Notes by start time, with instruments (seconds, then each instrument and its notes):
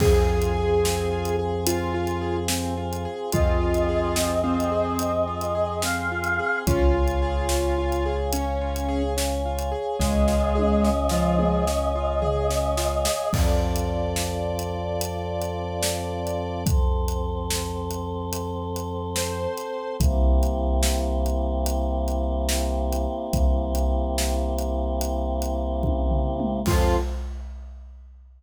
0.00 synth bass 2 F2, acoustic grand piano C4, choir aahs C4 F4 G#4, lead 1 (square) G#4, kick, crash
0.27 acoustic grand piano F4
0.42 closed hi-hat
0.55 acoustic grand piano G#4
0.83 acoustic grand piano C4, snare
1.11 acoustic grand piano F4
1.25 closed hi-hat
1.39 acoustic grand piano G#4
1.67 acoustic grand piano C4, lead 1 (square) F4, closed hi-hat
1.94 acoustic grand piano F4
2.07 closed hi-hat
2.21 acoustic grand piano G#4
2.48 acoustic grand piano C4, snare
2.77 acoustic grand piano F4
2.93 closed hi-hat
3.05 acoustic grand piano G#4
3.32 synth bass 2 F2, acoustic grand piano C4, choir aahs C4 G#4 C5 D#5, lead 1 (square) F4, kick, closed hi-hat
3.61 acoustic grand piano F4
3.74 closed hi-hat
3.89 acoustic grand piano G#4
4.16 acoustic grand piano C4, snare
4.44 lead 1 (square) C4, acoustic grand piano F4
4.60 closed hi-hat
4.72 acoustic grand piano G#4
4.99 acoustic grand piano C4, closed hi-hat
5.27 acoustic grand piano F4
5.41 closed hi-hat
5.55 acoustic grand piano G#4
5.82 acoustic grand piano C4, choir aahs F5, snare
6.12 acoustic grand piano F4
6.24 closed hi-hat
6.39 acoustic grand piano G#4
6.67 synth bass 2 C#2, acoustic grand piano C#4, lead 1 (square) F4, choir aahs C#5 F5 G#5, kick, closed hi-hat
6.94 acoustic grand piano F4
7.08 closed hi-hat
7.22 acoustic grand piano G#4
7.49 acoustic grand piano C#4, snare
7.78 acoustic grand piano F4
7.92 closed hi-hat
8.06 acoustic grand piano G#4
8.33 acoustic grand piano C#4, lead 1 (square) C#4, closed hi-hat
8.61 acoustic grand piano F4
8.76 closed hi-hat
8.89 acoustic grand piano G#4
9.17 acoustic grand piano C#4, snare
9.45 acoustic grand piano F4
9.59 closed hi-hat
9.72 acoustic grand piano G#4
9.99 synth bass 2 C#2, lead 1 (square) G#3, acoustic grand piano C#4, choir aahs D#5, kick, snare
10.28 acoustic grand piano F4, snare
10.55 acoustic grand piano G#4, high tom
10.83 acoustic grand piano C#4, snare
11.09 lead 1 (square) F3, acoustic grand piano F4, snare
11.38 acoustic grand piano G#4, mid tom
11.67 acoustic grand piano C#4, snare
11.95 acoustic grand piano F4
12.22 acoustic grand piano G#4, floor tom
12.49 acoustic grand piano C#4, snare
12.77 acoustic grand piano F4, snare
13.05 acoustic grand piano G#4, snare
13.33 synth bass 2 F2, choir aahs C4 F4 A4, lead 1 (square) D5, kick, crash
13.76 closed hi-hat
14.16 snare
14.59 closed hi-hat
15.01 closed hi-hat
15.42 closed hi-hat
15.83 snare
16.27 closed hi-hat
16.66 choir aahs C4 A4 C5, kick, closed hi-hat
17.08 closed hi-hat
17.50 snare
17.91 closed hi-hat
18.33 closed hi-hat
18.76 closed hi-hat
19.16 lead 1 (square) C5, snare
19.57 closed hi-hat
20.00 synth bass 2 C2, choir aahs A#3 C4 E4 G4, kick, closed hi-hat
20.43 closed hi-hat
20.83 snare
21.26 closed hi-hat
21.66 closed hi-hat
22.08 closed hi-hat
22.49 snare
22.92 closed hi-hat
23.33 synth bass 2 C2, kick, closed hi-hat
23.75 closed hi-hat
24.18 snare
24.58 closed hi-hat
25.01 closed hi-hat
25.42 closed hi-hat
25.83 kick, high tom
26.10 floor tom
26.40 mid tom
26.66 synth bass 2 F2, choir aahs C4 F4 A4, lead 1 (square) F4, kick, crash